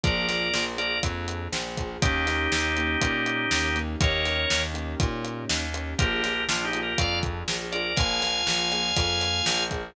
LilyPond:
<<
  \new Staff \with { instrumentName = "Drawbar Organ" } { \time 4/4 \key bes \major \tempo 4 = 121 <bes' d''>4. <bes' d''>8 r2 | <ees' g'>1 | <bes' des''>4. r2 r8 | <g' bes'>4 \tuplet 3/2 { <d' f'>8 <ees' g'>8 <g' bes'>8 } <d'' f''>8 r4 <bes' d''>8 |
<f'' aes''>1 | }
  \new Staff \with { instrumentName = "Acoustic Grand Piano" } { \time 4/4 \key bes \major <bes d' f' aes'>8 <bes d' f' aes'>8 <bes d' f' aes'>8 <bes d' f' aes'>2 <bes d' f' aes'>8 | <bes des' ees' g'>8 <bes des' ees' g'>8 <bes des' ees' g'>8 <bes des' ees' g'>2 <bes des' ees' g'>8 | <bes des' ees' g'>8 <bes des' ees' g'>8 <bes des' ees' g'>8 <bes des' ees' g'>2 <bes des' ees' g'>8 | <bes d' f' aes'>8 <bes d' f' aes'>8 <bes d' f' aes'>8 <bes d' f' aes'>2 <bes d' f' aes'>8 |
<bes d' f' aes'>8 <bes d' f' aes'>8 <bes d' f' aes'>8 <bes d' f' aes'>2 <bes d' f' aes'>8 | }
  \new Staff \with { instrumentName = "Electric Bass (finger)" } { \clef bass \time 4/4 \key bes \major bes,,4 bes,,4 f,4 bes,,4 | ees,4 ees,4 bes,4 ees,4 | ees,4 ees,4 bes,4 ees,4 | bes,,4 bes,,4 f,4 bes,,4 |
bes,,4 bes,,4 f,4 bes,,4 | }
  \new DrumStaff \with { instrumentName = "Drums" } \drummode { \time 4/4 <hh bd>8 <hh sn>8 sn8 hh8 <hh bd>8 hh8 sn8 <hh bd>8 | <hh bd>8 <hh sn>8 sn8 hh8 <hh bd>8 hh8 sn8 hh8 | <hh bd>8 <hh sn>8 sn8 hh8 <hh bd>8 hh8 sn8 hh8 | <hh bd>8 <hh sn>8 sn8 hh8 <hh bd>8 <hh bd>8 sn8 hh8 |
<hh bd>8 <hh sn>8 sn8 hh8 <hh bd>8 hh8 sn8 <hh bd>8 | }
>>